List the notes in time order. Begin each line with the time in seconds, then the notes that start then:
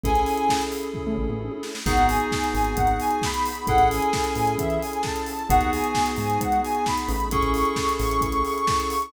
0.04 A1 C#4 E4 G#4 A4 G#5, kick, closed hi-hat
0.15 closed hi-hat
0.26 open hi-hat
0.37 closed hi-hat
0.49 kick, snare
0.61 closed hi-hat
0.72 open hi-hat
0.83 closed hi-hat
0.94 kick, floor tom
1.06 A2, floor tom
1.18 A1, mid tom
1.29 A1, mid tom
1.41 high tom
1.52 high tom
1.63 snare
1.75 snare
1.86 G#1 B3 D#4 F#4 G#4 F#5, kick, crash
1.97 G#1, closed hi-hat
2.09 G#5, open hi-hat
2.20 closed hi-hat
2.32 kick, snare
2.44 closed hi-hat
2.54 G#1 G#5, open hi-hat
2.64 closed hi-hat
2.77 G#1 F#5, kick, closed hi-hat
2.87 closed hi-hat
3.00 G#5, open hi-hat
3.11 G#5, closed hi-hat
3.22 B5, kick, snare
3.34 closed hi-hat
3.46 open hi-hat
3.55 closed hi-hat
3.67 A1 C#4 E4 G#4 A4 F#5, kick, closed hi-hat
3.78 A1, closed hi-hat
3.91 G#5, open hi-hat
4.02 closed hi-hat
4.13 kick, snare
4.24 closed hi-hat
4.35 A1 G#5, open hi-hat
4.47 closed hi-hat
4.58 E2 E5, kick, closed hi-hat
4.70 closed hi-hat
4.81 G#5, open hi-hat
4.93 G#5, closed hi-hat
5.03 A5, kick, snare
5.16 closed hi-hat
5.26 open hi-hat
5.39 closed hi-hat
5.49 G#1 B3 D#4 F#4 G#4 F#5, kick, closed hi-hat
5.61 D#2, closed hi-hat
5.72 G#5, open hi-hat
5.84 closed hi-hat
5.95 kick, snare
6.06 closed hi-hat
6.16 G#2 G#5, open hi-hat
6.30 closed hi-hat
6.40 G#2 F#5, kick, closed hi-hat
6.52 closed hi-hat
6.63 G#5, open hi-hat
6.75 G#5, closed hi-hat
6.86 B5, kick, snare
6.98 closed hi-hat
7.08 A1, open hi-hat
7.20 closed hi-hat
7.31 C#4 E4 G#4 A4 C#6, kick, closed hi-hat
7.43 A1, closed hi-hat
7.54 C#6, open hi-hat
7.65 closed hi-hat
7.76 kick, snare
7.89 closed hi-hat
8.00 A1 C#6, open hi-hat
8.11 closed hi-hat
8.21 A1 C#6, kick, closed hi-hat
8.32 closed hi-hat
8.45 C#6, open hi-hat
8.56 C#6, closed hi-hat
8.67 C#6, kick, snare
8.80 closed hi-hat
8.90 open hi-hat
9.02 closed hi-hat